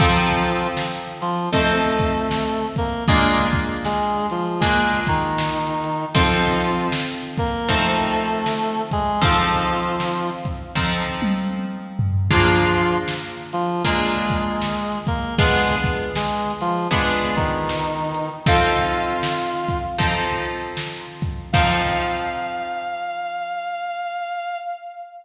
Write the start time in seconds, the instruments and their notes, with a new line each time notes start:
0.00 clarinet F3 F4, acoustic guitar (steel) F3 C4 D#4 A4, kick, closed hi-hat
0.45 closed hi-hat
0.77 snare
1.21 clarinet F3 F4, closed hi-hat
1.53 acoustic guitar (steel) F3 C4 D#4 A4, clarinet A3 A4, kick, closed hi-hat
1.99 kick, closed hi-hat
2.31 snare
2.76 clarinet A#3 A#4, kick, closed hi-hat
3.08 clarinet G#3 G#4, acoustic guitar (steel) A#3 D4 F4 G#4, kick, closed hi-hat
3.53 kick, closed hi-hat
3.85 clarinet G#3 G#4, snare
4.30 clarinet F3 F4, closed hi-hat
4.61 clarinet G#3 G#4, acoustic guitar (steel) A#3 D4 F4 G#4, kick, closed hi-hat
5.07 clarinet D#3 D#4, kick, closed hi-hat
5.38 snare
5.84 closed hi-hat
6.15 acoustic guitar (steel) F3 C4 D#4 A4, clarinet F3 F4, kick, closed hi-hat
6.61 closed hi-hat
6.92 snare
7.37 clarinet A#3 A#4, kick, closed hi-hat
7.69 acoustic guitar (steel) F3 C4 D#4 A4, clarinet A3 A4, kick, closed hi-hat
8.14 closed hi-hat
8.46 snare
8.91 clarinet G#3 G#4, kick, closed hi-hat
9.21 acoustic guitar (steel) F3 C4 D#4 A4, clarinet F3 F4, kick, closed hi-hat
9.68 closed hi-hat
10.00 snare
10.45 kick, closed hi-hat
10.75 acoustic guitar (steel) F3 C4 D#4 A4, kick, snare
11.22 high tom
11.99 floor tom
12.31 clarinet F3 F4, acoustic guitar (steel) A#3 D4 F4 G#4, kick, crash
12.76 closed hi-hat
13.08 snare
13.53 clarinet F3 F4, closed hi-hat
13.85 clarinet G#3 G#4, acoustic guitar (steel) A#3 D4 F4 G#4, kick, closed hi-hat
14.30 kick, closed hi-hat
14.61 snare
15.07 clarinet A#3 A#4, kick, closed hi-hat
15.38 clarinet G#3 G#4, acoustic guitar (steel) B3 D4 F4 G#4, kick, closed hi-hat
15.84 kick, closed hi-hat
16.15 clarinet G#3 G#4, snare
16.61 clarinet F3 F4, closed hi-hat
16.91 clarinet G#3 G#4, acoustic guitar (steel) B3 D4 F4 G#4, kick, closed hi-hat
17.36 clarinet D#3 D#4, kick, closed hi-hat
17.69 snare
18.14 closed hi-hat
18.46 acoustic guitar (steel) F3 C4 D#4 A4, clarinet F4 F5, kick, closed hi-hat
18.91 closed hi-hat
19.23 snare
19.68 kick, closed hi-hat
19.98 acoustic guitar (steel) F3 C4 D#4 A4, kick, closed hi-hat
20.45 closed hi-hat
20.77 snare
21.22 kick, closed hi-hat
21.53 acoustic guitar (steel) F3 C4 D#4 A4, clarinet F5, kick, crash